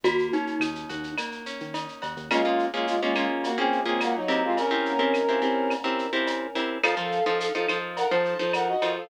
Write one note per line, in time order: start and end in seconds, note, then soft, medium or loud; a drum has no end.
0.04 0.29 D#2 medium
0.04 1.18 A#3 loud
0.04 0.28 F#4 loud
0.04 cowbell medium
0.04 shaker medium
0.19 shaker medium
0.33 1.46 C#4 medium
0.33 1.12 D#4 medium
0.33 shaker medium
0.47 shaker medium
0.59 0.85 D#2 medium
0.59 1.73 D#4 medium
0.59 claves medium
0.59 shaker medium
0.75 shaker medium
0.89 1.15 D#2 medium
0.89 2.01 F#4 medium
0.89 shaker medium
1.03 shaker medium
1.18 2.26 A#3 medium
1.18 cowbell medium
1.18 claves medium
1.18 shaker medium
1.32 shaker medium
1.46 2.27 C#4 medium
1.46 shaker medium
1.60 1.87 D#3 medium
1.60 shaker medium
1.74 2.28 D#4 medium
1.74 cowbell medium
1.74 shaker medium
1.88 shaker medium
2.02 2.15 D#2 medium
2.02 2.29 F#4 medium
2.02 cowbell medium
2.02 shaker medium
2.17 2.29 D#2 medium
2.17 shaker medium
2.31 2.66 G#3 medium
2.31 2.42 A#3 loud
2.31 2.42 C#4 loud
2.31 2.42 F4 loud
2.31 2.66 F4 medium
2.31 2.42 G#4 medium
2.31 cowbell medium
2.31 claves medium
2.31 shaker medium
2.45 2.68 A#3 medium
2.45 2.68 C#4 medium
2.45 2.68 F4 loud
2.45 2.68 G#4 medium
2.59 shaker medium
2.73 2.86 G#3 soft
2.73 2.96 A#3 loud
2.73 2.96 C#4 medium
2.73 2.86 F4 medium
2.73 2.96 F4 medium
2.73 2.96 G#4 medium
2.87 3.01 G#3 medium
2.87 3.01 F4 medium
2.87 shaker medium
3.01 3.26 G#3 medium
3.01 3.14 A#3 medium
3.01 3.14 C#4 medium
3.01 3.26 F4 medium
3.01 3.14 F4 medium
3.01 3.14 G#4 medium
3.16 3.50 A#3 medium
3.16 3.50 C#4 loud
3.16 3.50 F4 loud
3.16 3.50 G#4 medium
3.16 claves medium
3.16 shaker medium
3.44 3.58 A#3 medium
3.44 3.58 F#4 medium
3.44 cowbell medium
3.44 shaker medium
3.58 3.80 A#3 loud
3.58 3.81 C4 medium
3.58 3.80 C#4 medium
3.58 3.80 F4 medium
3.58 3.80 G#4 loud
3.58 3.81 G#4 medium
3.72 shaker medium
3.85 4.19 A#3 loud
3.85 4.00 C4 medium
3.85 4.19 C#4 medium
3.85 4.19 F4 medium
3.85 4.19 G#4 loud
3.85 4.00 G#4 medium
4.01 4.15 A#3 medium
4.01 4.15 F#4 medium
4.01 cowbell medium
4.01 claves medium
4.01 shaker medium
4.15 4.43 F#3 medium
4.15 4.43 D#4 medium
4.28 4.68 C4 loud
4.28 4.68 E4 medium
4.28 4.68 G4 loud
4.28 4.68 A#4 loud
4.28 cowbell medium
4.28 shaker medium
4.44 4.57 G#3 medium
4.44 4.57 F4 medium
4.57 5.73 C#4 medium
4.57 5.73 A#4 medium
4.57 cowbell medium
4.57 shaker medium
4.71 4.94 C4 medium
4.71 4.94 E4 medium
4.71 4.94 G4 loud
4.71 4.94 A#4 loud
4.85 shaker medium
4.99 5.22 C4 medium
4.99 5.22 E4 loud
4.99 5.22 G4 medium
4.99 5.22 A#4 medium
5.14 claves medium
5.14 shaker medium
5.29 5.40 C4 medium
5.29 5.40 E4 medium
5.29 5.40 G4 medium
5.29 5.40 A#4 medium
5.42 5.76 C4 medium
5.42 5.76 E4 medium
5.42 5.76 G4 medium
5.42 5.76 A#4 medium
5.42 shaker medium
5.70 cowbell medium
5.70 claves medium
5.70 shaker medium
5.84 6.07 C4 loud
5.84 6.07 E4 medium
5.84 6.07 G4 loud
5.84 6.07 A#4 loud
5.99 shaker medium
6.13 6.47 C4 loud
6.13 6.47 E4 loud
6.13 6.47 G4 medium
6.13 6.47 A#4 loud
6.27 cowbell medium
6.27 shaker medium
6.55 6.78 C4 medium
6.55 6.78 E4 loud
6.55 6.78 G4 medium
6.55 6.78 A#4 medium
6.55 cowbell medium
6.55 shaker medium
6.83 6.95 F3 loud
6.83 6.95 D#4 loud
6.83 6.95 A4 loud
6.83 7.25 A4 medium
6.83 6.95 C5 loud
6.83 7.25 F5 medium
6.83 cowbell medium
6.83 claves loud
6.83 shaker medium
6.97 7.20 F3 loud
6.97 7.20 D#4 medium
6.97 7.20 A4 medium
6.97 7.20 C5 loud
7.12 shaker medium
7.26 7.49 F3 loud
7.26 7.49 D#4 loud
7.26 7.49 A4 medium
7.26 7.39 A4 medium
7.26 7.49 C5 loud
7.26 7.39 F5 medium
7.40 7.53 A4 medium
7.40 7.53 F5 medium
7.40 shaker loud
7.54 7.66 F3 loud
7.54 7.66 D#4 loud
7.54 7.78 A4 medium
7.54 7.66 A4 medium
7.54 7.66 C5 medium
7.54 7.78 F5 medium
7.69 8.03 F3 medium
7.69 8.03 D#4 medium
7.69 8.03 A4 medium
7.69 8.03 C5 medium
7.69 claves medium
7.69 shaker medium
7.97 8.10 A#4 medium
7.97 8.10 F#5 medium
7.97 cowbell medium
7.97 shaker medium
8.11 8.34 F3 medium
8.11 8.34 D#4 loud
8.11 8.34 A4 medium
8.11 8.38 C5 medium
8.11 8.34 C5 medium
8.11 8.38 A5 medium
8.25 shaker medium
8.39 8.73 F3 medium
8.39 8.73 D#4 medium
8.39 8.73 A4 loud
8.39 8.52 C5 medium
8.39 8.73 C5 medium
8.39 8.52 A5 medium
8.53 8.68 A#4 medium
8.53 8.68 F#5 medium
8.53 cowbell medium
8.53 claves medium
8.53 shaker medium
8.68 8.93 F#4 medium
8.68 8.93 D#5 medium
8.82 9.05 F3 loud
8.82 9.05 D#4 loud
8.82 9.05 A4 medium
8.82 9.05 C5 medium
8.82 cowbell medium
8.82 shaker medium
8.96 9.09 A4 medium
8.96 9.09 F5 medium